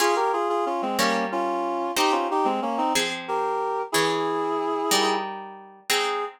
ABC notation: X:1
M:6/8
L:1/16
Q:3/8=61
K:Ab
V:1 name="Clarinet"
[FA] [GB] [FA] [FA] [DF] [A,C] [B,D]2 [DF]4 | [EG] [DF] [EG] [A,C] [B,D] [CE] z2 [GB]4 | [_FA]8 z4 | A6 z6 |]
V:2 name="Orchestral Harp"
[DFA]6 [G,DB]6 | [CEG]6 [F,CA]6 | [_F,DA]6 [G,EB]6 | [A,CE]6 z6 |]